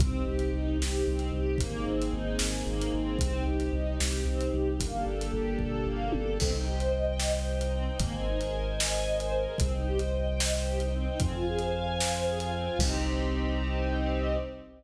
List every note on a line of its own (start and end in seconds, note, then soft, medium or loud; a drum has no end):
0.00 0.23 C2 medium
0.00 0.24 C4 medium
0.00 1.59 C4 medium
0.00 1.59 D#4 medium
0.00 1.59 G4 loud
0.00 kick loud
0.00 closed hi-hat medium
0.27 0.50 C2 medium
0.27 0.51 G4 medium
0.39 closed hi-hat medium
0.53 0.77 C2 medium
0.53 0.77 D#4 medium
0.79 1.02 C2 medium
0.79 1.04 G4 medium
0.79 snare medium
1.07 1.30 C2 medium
1.07 1.31 C4 medium
1.19 closed hi-hat medium
1.32 1.55 C2 medium
1.32 1.57 G4 medium
1.58 1.82 G#1 medium
1.58 3.18 A#3 medium
1.58 1.85 A#3 medium
1.58 3.18 C4 loud
1.58 3.18 D#4 medium
1.58 3.18 G#4 medium
1.58 kick loud
1.58 closed hi-hat loud
1.87 2.10 G#1 medium
1.87 2.11 C4 medium
2.02 closed hi-hat medium
2.13 2.36 G#1 medium
2.13 2.37 D#4 medium
2.39 2.63 G#1 medium
2.39 2.64 G#4 medium
2.39 snare loud
2.67 2.89 G#1 medium
2.67 2.91 A#3 medium
2.81 closed hi-hat medium
2.94 3.17 G#1 medium
2.94 3.18 C4 medium
3.19 3.42 C2 medium
3.19 4.78 C4 loud
3.19 3.44 C4 loud
3.19 4.78 D#4 loud
3.19 4.78 G4 loud
3.19 kick loud
3.19 closed hi-hat loud
3.46 3.68 C2 medium
3.46 3.71 G4 medium
3.60 closed hi-hat medium
3.73 3.96 C2 medium
3.73 3.97 D#4 medium
4.00 4.23 C2 medium
4.00 4.24 G4 medium
4.00 snare loud
4.25 4.48 C2 medium
4.25 4.51 C4 medium
4.41 closed hi-hat medium
4.53 4.76 C2 medium
4.53 4.77 G4 medium
4.79 5.03 G1 loud
4.79 6.38 A#3 medium
4.79 5.04 A#3 loud
4.79 6.38 D4 medium
4.79 6.38 G4 medium
4.79 6.38 A4 loud
4.79 kick medium
4.79 closed hi-hat loud
5.06 5.29 G1 medium
5.06 5.31 A4 medium
5.21 closed hi-hat medium
5.33 5.56 G1 medium
5.33 5.57 G4 medium
5.59 5.83 G1 medium
5.59 5.84 A4 medium
5.59 kick medium
5.59 floor tom medium
5.87 6.09 G1 medium
5.87 6.11 A#3 medium
6.12 6.37 G1 medium
6.12 6.37 A4 medium
6.12 high tom medium
6.39 7.88 C2 loud
6.39 6.52 C4 loud
6.39 7.98 C5 medium
6.39 7.98 D#5 medium
6.39 7.98 G5 medium
6.39 kick loud
6.39 crash loud
6.53 6.65 D#4 medium
6.67 6.79 G4 medium
6.79 6.91 C5 medium
6.79 closed hi-hat medium
6.93 7.05 D#5 medium
7.07 7.19 G5 medium
7.19 7.32 D#5 medium
7.19 snare loud
7.34 7.46 C5 medium
7.47 7.59 G4 medium
7.60 7.72 D#4 medium
7.60 closed hi-hat medium
7.74 7.86 C4 medium
7.86 7.98 D#4 medium
7.99 9.47 G#1 loud
7.99 8.12 A#3 loud
7.99 9.58 A#4 medium
7.99 9.58 C5 medium
7.99 9.58 D#5 medium
7.99 9.58 G#5 medium
7.99 kick loud
7.99 closed hi-hat loud
8.13 8.25 C4 medium
8.26 8.38 D#4 medium
8.40 8.52 G#4 medium
8.40 closed hi-hat medium
8.53 8.65 A#4 medium
8.67 8.79 C5 medium
8.80 8.92 D#5 medium
8.80 snare loud
8.93 9.05 G#5 medium
9.07 9.19 D#5 loud
9.20 9.32 C5 medium
9.20 closed hi-hat medium
9.34 9.46 A#4 medium
9.46 9.58 G#4 medium
9.58 11.08 C2 loud
9.58 9.72 C4 loud
9.58 11.19 C5 medium
9.58 11.20 D#5 medium
9.58 11.20 G5 medium
9.58 kick loud
9.58 closed hi-hat loud
9.73 9.85 D#4 medium
9.87 9.99 G4 medium
9.99 10.12 C5 medium
9.99 closed hi-hat medium
10.14 10.26 D#5 medium
10.27 10.39 G5 medium
10.40 10.53 D#5 medium
10.40 snare loud
10.53 10.65 C5 medium
10.67 10.79 G4 medium
10.80 10.92 D#4 medium
10.80 closed hi-hat medium
10.93 11.05 C4 medium
11.07 11.19 D#4 medium
11.19 12.69 F2 loud
11.19 11.32 C4 loud
11.19 12.78 C5 medium
11.19 12.78 F5 medium
11.19 12.78 G#5 medium
11.19 kick loud
11.19 closed hi-hat loud
11.33 11.45 F4 medium
11.47 11.59 G#4 medium
11.59 11.72 C5 medium
11.59 closed hi-hat medium
11.74 11.86 F5 medium
11.86 11.98 G#5 medium
12.00 12.12 F5 medium
12.00 snare loud
12.14 12.26 C5 medium
12.27 12.39 G#4 medium
12.39 12.51 F4 medium
12.39 closed hi-hat medium
12.53 12.65 C4 medium
12.67 12.79 F4 medium
12.79 14.36 C2 loud
12.79 14.37 C4 medium
12.79 14.37 C4 loud
12.79 14.37 D#4 medium
12.79 14.37 G4 medium
12.79 14.37 G4 loud
12.79 kick loud
12.79 crash loud